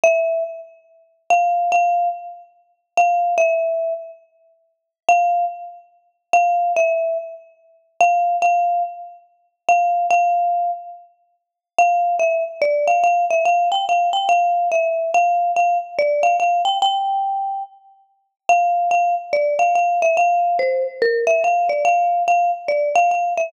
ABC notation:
X:1
M:4/4
L:1/8
Q:"Swing" 1/4=143
K:F
V:1 name="Marimba"
e2 z4 f2 | f2 z4 f2 | e3 z5 | f2 z4 f2 |
e2 z4 f2 | f2 z4 f2 | f3 z5 | f2 e z d f f e |
f g f g f2 e2 | f2 f z d f f g | g4 z4 | f2 f z d f f e |
f2 c z B e f d | f2 f z d f f e |]